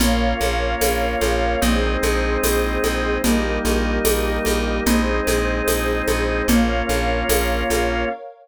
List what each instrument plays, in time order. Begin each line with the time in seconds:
0.00 electric bass (finger) A#1, drawbar organ A#3 C#4 F4, pad 2 (warm) A#4 C#5 F5, low conga, shaker
0.41 electric bass (finger) A#1, high conga, shaker
0.81 electric bass (finger) A#1, tambourine, high conga, shaker
1.21 electric bass (finger) A#1, high conga, shaker
1.61 electric bass (finger) A#1, drawbar organ G#3 C4 D#4, pad 2 (warm) G#4 C5 D#5, low conga, shaker
2.03 electric bass (finger) A#1, high conga, shaker
2.43 electric bass (finger) A#1, tambourine, high conga, shaker
2.84 electric bass (finger) A#1, high conga, shaker
3.24 electric bass (finger) A#1, drawbar organ G3 A#3 D#4, pad 2 (warm) G4 A#4 D#5, low conga, shaker
3.65 electric bass (finger) A#1, high conga, shaker
4.05 electric bass (finger) A#1, tambourine, high conga, shaker
4.45 electric bass (finger) A#1, high conga, shaker
4.86 electric bass (finger) A#1, drawbar organ G#3 C4 D#4, pad 2 (warm) G#4 C5 D#5, low conga, shaker
5.27 electric bass (finger) A#1, high conga, shaker
5.67 electric bass (finger) A#1, tambourine, high conga, shaker
6.07 electric bass (finger) A#1, high conga, shaker
6.48 electric bass (finger) A#1, drawbar organ A#3 C#4 F4, pad 2 (warm) A#4 C#5 F5, low conga, shaker
6.89 electric bass (finger) A#1, high conga, shaker
7.29 electric bass (finger) A#1, tambourine, high conga, shaker
7.70 electric bass (finger) A#1, high conga, shaker